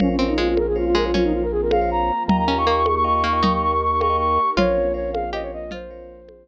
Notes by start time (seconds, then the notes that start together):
0.00 A#1 A#3 C4 C#4 F4 A#4 C5 C#5 F5, low conga
0.09 C#4
0.18 C4 C#4 A#4 C5 C#5 F5
0.28 D#4 A#4 C5 C#5 F5
0.38 G#3 F4
0.49 F4
0.57 A#4, high conga
0.67 G#4
0.76 F4 A#4 C5 C#5 F5
0.86 F4
0.95 G#3 A#4
1.04 F4 A#4 C5 C#5 F5
1.14 F3 A#3 C4 C#4 F4 A#4 C5 C#5 F5, low conga
1.24 D#4
1.33 F4
1.42 A#4
1.52 G#4
1.62 A#4
1.71 A#4 C5 C#5 F5, high conga
1.81 A#4 C5 C#5 F5
1.91 A#5
2.27 D#2 A#3 D#4 F4 G4 A#4 D#5 F5 G5 A#5, low conga
2.38 A#5
2.47 C#4 A#4 D#5 F5 G5 A#5
2.58 A#4 D#5 F5 G5 C#6
2.67 A#3 C#6
2.76 C#6
2.86 C#6, high conga
2.95 C#6
3.04 A#4 D#5 F5 G5 C#6
3.14 C#6
3.24 A#3 C#6
3.33 A#4 D#5 F5 G5 C#6
3.43 A#3 D#4 G4 A#4 D#5 F5 G5 C#6, low conga
3.53 C#6
3.62 C#6
3.72 C#6
3.83 C#6
3.92 C#6
4.00 A#4 D#5 F5 G5 C#6, high conga
4.10 A#4 D#5 F5 G5
4.18 C#6
4.57 A#1 A#3 C4 C#4 F4 A#4 C5 C#5 F5, low conga
4.94 A#4 C5 C#5 F5
5.13 F5, high conga
5.33 G4 A#4 C5 C#5 D#5 F5
5.42 C#5
5.53 D#5
5.71 F3 A#3 C4 F4 C5, low conga
5.91 A#4 C5 C#5 F5
6.29 high conga